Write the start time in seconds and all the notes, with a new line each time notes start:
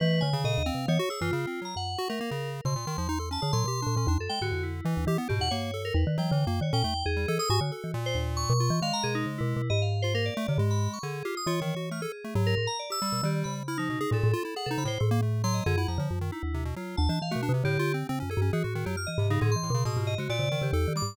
0.00 E3 A3 B4
0.21 D3 G#5
0.33 C#3
0.44 A#2 D#5
0.58 D#2
0.66 C4 F5
0.74 C3
0.88 E3 B3 C#5
0.99 F#4
1.10 G#4 E6
1.21 F#2 E3 F4
1.32 C#3 F4
1.47 C4
1.62 F#3 A#5
1.76 F#2 F#5
1.98 F#4
2.09 A3 A#4
2.21 A#3
2.31 C#3
2.65 B2 C#3 C6
2.76 A#2
2.87 D#3
2.98 E2 F3
3.09 D#4
3.19 A4
3.31 C#4 A5
3.42 D3 G#4
3.53 A#2 F#3 C6
3.64 B2 G4
3.82 D4
3.87 A#2
3.97 A#2 C#4
4.07 E2 D4
4.18 F#2 A4
4.29 G#3 G5
4.41 G#2 D3 F#4
4.52 F2
4.63 E4
4.85 E3
4.97 D#2
5.07 E3 G4
5.18 B3
5.29 G#2 B2 G4
5.40 E2 F#5
5.51 G2 A#3 C#5
5.74 A4
5.85 A#4
5.94 E2 B4
6.07 D#3
6.18 E3 F#3 G5
6.31 D3 E3
6.47 F#2 A#3
6.61 D#3 C#5
6.73 A#2 C#4 G5
6.84 E2 A3
7.06 E2 G#4
7.17 G3
7.28 E3 A4
7.39 A4 D#6
7.50 G#2 F#4 G#5
7.61 D3 F#4
7.72 A4
7.84 E3
7.94 A#2
8.06 C5
8.15 D#2
8.37 C#6
8.50 B2
8.60 F4
8.70 E3
8.82 D#3 G#3 F5
8.93 A#5
9.03 B2 G#4
9.15 D#4
9.26 C#3
9.38 B2 E4
9.56 B2
9.70 G#2 D#5
9.82 F5
10.02 F4 C5
10.14 A#3 A#4
10.26 D5
10.37 A3
10.48 C3 D3
10.58 G#2 G#3
10.71 B5
10.93 C#6
11.03 D3 G#4
11.25 F4 G4
11.37 D#6
11.46 E3 F4 C#5
11.61 D#3
11.76 F#4
11.91 A3 F6
12.02 G#4 A4
12.24 A3
12.35 G#2 F#3
12.47 A#4
12.57 A2
12.67 A#5
12.79 D5
12.90 G4 E6
13.02 G3
13.12 B2
13.23 D#3 G3 G4
13.44 C#3 B5
13.68 E4 F6
13.78 F3 D#4
13.90 B2
14.01 D#4 G#4
14.11 A2 A#2 A4
14.24 A2
14.33 F4
14.45 E4
14.56 G#4 F#5
14.66 C3 A4
14.71 D#4
14.78 C#3 B5
14.85 A2 C5
15.00 A2 A4
15.11 A#3
15.22 A3
15.44 F#3 C6
15.54 D#5
15.66 F#2 D3 G#4
15.78 E4 F#5
15.88 F2 F3 A#5
15.98 D3 F3
16.11 F#2
16.21 D#3
16.32 D#4 E4
16.43 D#2
16.54 C3
16.65 B2
16.76 F#3 F4
16.97 D#2 A5
17.09 E3 D4
17.22 E3 F5
17.31 A3 F#4
17.36 B2
17.43 D4
17.49 C3
17.54 C3
17.64 A2 D3 G4
17.79 F4
17.94 C4
18.09 C#3 C4
18.20 F#2 C#4
18.30 G#4 A4
18.37 G2
18.42 C#4
18.53 E3 F#4 G#4
18.64 A2 F#4
18.75 D#3
18.86 F#2 F#3 G4
18.97 F6
19.07 E3 D#5
19.18 G#2 C3
19.30 C#3 D#4
19.41 A2 D3 G#4
19.52 C6
19.56 E3
19.63 A2
19.70 B2
19.74 C#3
19.85 A2 B2 D#6
19.97 G#2 F4
20.07 D#5
20.18 C#3 G#3 F#4
20.29 A#2 D5
20.39 C#3
20.52 D#3
20.61 C#3 G4
20.73 E2 A4
20.88 D#3
20.95 G3 D6
21.02 G#2